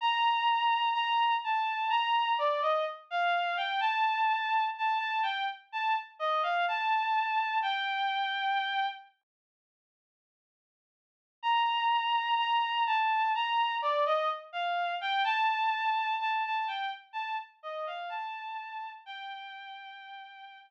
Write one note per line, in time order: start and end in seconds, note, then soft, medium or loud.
0.01 0.89 A#5 medium
0.93 1.34 A#5 medium
1.44 1.90 A5 medium
1.90 2.33 A#5 medium
2.38 2.61 D5 medium
2.62 2.85 D#5 medium
3.11 3.57 F5 medium
3.57 3.80 G5 medium
3.80 4.64 A5 medium
4.78 4.98 A5 medium
4.99 5.21 A5 medium
5.23 5.45 G5 medium
5.72 5.95 A5 medium
6.19 6.42 D#5 medium
6.43 6.65 F5 medium
6.68 7.58 A5 medium
7.62 8.86 G5 medium
11.42 12.35 A#5 medium
12.37 12.83 A#5 medium
12.86 13.32 A5 medium
13.35 13.76 A#5 medium
13.82 14.05 D5 medium
14.06 14.29 D#5 medium
14.53 14.95 F5 medium
15.01 15.24 G5 medium
15.24 16.15 A5 medium
16.20 16.42 A5 medium
16.45 16.67 A5 medium
16.67 16.90 G5 medium
17.13 17.35 A5 medium
17.63 17.85 D#5 medium
17.87 18.09 F5 medium
18.09 18.90 A5 medium
19.06 20.59 G5 medium